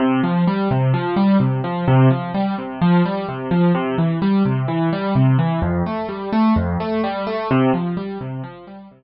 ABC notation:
X:1
M:4/4
L:1/8
Q:1/4=128
K:C
V:1 name="Acoustic Grand Piano"
C, F, G, C, F, G, C, F, | C, F, G, C, F, G, C, F, | C, E, G, C, E, G, C, E, | F,, A, G, A, F,, A, G, A, |
C, F, G, C, F, G, C, z |]